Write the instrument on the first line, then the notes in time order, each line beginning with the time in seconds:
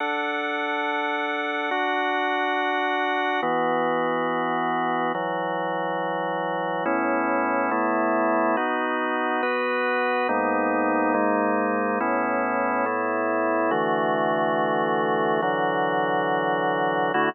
drawbar organ
0.00 D4 A4 F#5
1.71 D4 F#4 F#5
3.42 E3 B3 F#4
5.14 E3 F#3 F#4
6.85 A2 B3 C#4 E4
7.71 A2 A3 B3 E4
8.57 B3 D#4 F#4
9.43 B3 F#4 B4
10.29 G#2 A#3 B3 D#4
11.14 G#2 G#3 A#3 D#4
12.00 A2 B3 C#4 E4
12.86 A2 A3 B3 E4
13.71 D3 E3 A3 F#4
15.42 D3 E3 F#3 F#4
17.14 D3 A3 E4 F#4